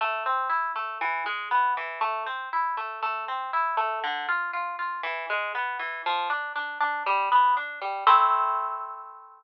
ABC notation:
X:1
M:4/4
L:1/8
Q:1/4=119
K:Am
V:1 name="Orchestral Harp"
A, C E A, E, ^G, B, E, | A, C E A, A, C E A, | D, F F F E, ^G, B, E, | F, D D D G, B, D G, |
[A,CE]8 |]